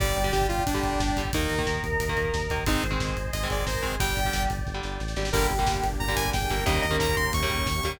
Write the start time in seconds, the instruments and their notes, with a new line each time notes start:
0.00 synth bass 1 G1, overdriven guitar D3 G3, choir aahs G3, lead 2 (sawtooth) D5, pad 5 (bowed) D5 G5, kick, crash
0.08 kick
0.16 synth bass 1 G1, lead 2 (sawtooth) D5, kick, closed hi-hat
0.24 overdriven guitar D3 G3, kick
0.32 synth bass 1 G1, lead 2 (sawtooth) G4, kick, snare
0.42 kick
0.49 synth bass 1 G1, lead 2 (sawtooth) F4, kick, closed hi-hat
0.58 kick
0.66 synth bass 1 G1, lead 2 (sawtooth) D4, kick, closed hi-hat
0.74 overdriven guitar D3 G3, kick
0.83 synth bass 1 G1, kick, closed hi-hat
0.92 kick
1.00 synth bass 1 G1, kick, snare
1.09 kick
1.16 synth bass 1 G1, overdriven guitar D3 G3, kick, closed hi-hat
1.25 kick
1.33 synth bass 1 D#2, overdriven guitar D#3 A#3, lead 2 (sawtooth) D#4, choir aahs A#4, pad 5 (bowed) D#5 A#5, kick, closed hi-hat
1.42 kick
1.50 synth bass 1 D#2, kick, closed hi-hat
1.58 overdriven guitar D#3 A#3, kick
1.66 synth bass 1 D#2, kick, snare
1.75 kick
1.83 synth bass 1 D#2, kick, closed hi-hat
1.92 kick
2.00 synth bass 1 D#2, kick, closed hi-hat
2.08 overdriven guitar D#3 A#3, kick
2.17 synth bass 1 D#2, kick, closed hi-hat
2.25 kick
2.34 synth bass 1 D#2, kick, snare
2.42 kick
2.50 synth bass 1 D#2, overdriven guitar D#3 A#3, kick, closed hi-hat
2.58 kick
2.66 synth bass 1 G#1, overdriven guitar D#3 G#3 C4, lead 2 (sawtooth) D#4, choir aahs C5, pad 5 (bowed) D#5 G#5 C6, kick, closed hi-hat
2.75 kick
2.83 synth bass 1 G#1, kick, closed hi-hat
2.91 overdriven guitar D#3 G#3 C4, kick
3.00 synth bass 1 G#1, kick, snare
3.08 kick
3.17 synth bass 1 G#1, kick, closed hi-hat
3.25 kick
3.33 synth bass 1 G#1, choir aahs G#4, lead 2 (sawtooth) D#5, kick, closed hi-hat
3.42 overdriven guitar D#3 G#3 C4, kick
3.50 synth bass 1 G#1, lead 2 (sawtooth) D5, kick, closed hi-hat
3.58 choir aahs A#4, kick
3.67 synth bass 1 G#1, lead 2 (sawtooth) C5, kick, snare
3.75 kick
3.82 synth bass 1 G#1, overdriven guitar D#3 G#3 C4, choir aahs G#4, kick, closed hi-hat
3.92 kick
3.99 synth bass 1 G1, overdriven guitar D3 G3, choir aahs G3, pad 5 (bowed) D5 G5, lead 2 (sawtooth) G5, kick, closed hi-hat
4.08 kick
4.16 synth bass 1 G1, kick, closed hi-hat
4.25 overdriven guitar D3 G3, kick
4.33 synth bass 1 G1, kick, snare
4.42 kick
4.50 synth bass 1 G1, kick, closed hi-hat
4.58 kick
4.67 synth bass 1 G1, kick, snare
4.74 overdriven guitar D3 G3
4.83 synth bass 1 G1, snare
5.00 synth bass 1 A1, snare
5.08 snare
5.16 synth bass 1 G#1, overdriven guitar D3 G3, snare
5.25 snare
5.32 synth bass 1 G1, overdriven guitar D3 G3 A#3, pad 5 (bowed) A#3 D4 G4, choir aahs G4, lead 2 (sawtooth) A#4, kick, crash
5.41 kick
5.50 synth bass 1 G1, kick, closed hi-hat
5.59 overdriven guitar D3 G3 A#3, kick
5.67 synth bass 1 G1, kick, snare
5.75 kick
5.83 synth bass 1 G1, kick, closed hi-hat
5.92 kick
6.00 synth bass 1 G1, choir aahs A#4, lead 2 (sawtooth) A#5, kick
6.08 overdriven guitar D3 G3 A#3, kick
6.16 synth bass 1 G1, lead 2 (sawtooth) G#5, kick, closed hi-hat
6.25 choir aahs G#4, kick
6.33 synth bass 1 G1, lead 2 (sawtooth) G5, kick, snare
6.42 kick
6.49 synth bass 1 G1, overdriven guitar D3 G3 A#3, choir aahs A#4, kick, closed hi-hat
6.58 kick
6.66 synth bass 1 D#2, overdriven guitar C#3 D#3 G3 A#3, pad 5 (bowed) A#3 C#4 D#4 G4, choir aahs A#4, lead 2 (sawtooth) D#5, kick, closed hi-hat
6.75 kick
6.82 synth bass 1 D#2, lead 2 (sawtooth) D#5, kick, closed hi-hat
6.91 overdriven guitar C#3 D#3 G3 A#3, kick
7.00 synth bass 1 D#2, lead 2 (sawtooth) A#5, kick, snare
7.08 kick
7.17 synth bass 1 D#2, lead 2 (sawtooth) C6, kick, closed hi-hat
7.25 kick
7.33 synth bass 1 D#2, lead 2 (sawtooth) C#6, kick, closed hi-hat
7.42 overdriven guitar C#3 D#3 G3 A#3, kick
7.50 synth bass 1 D#2, kick, closed hi-hat
7.58 kick
7.66 synth bass 1 D#2, kick, snare
7.75 kick
7.83 synth bass 1 D#2, overdriven guitar C#3 D#3 G3 A#3, kick, closed hi-hat
7.92 kick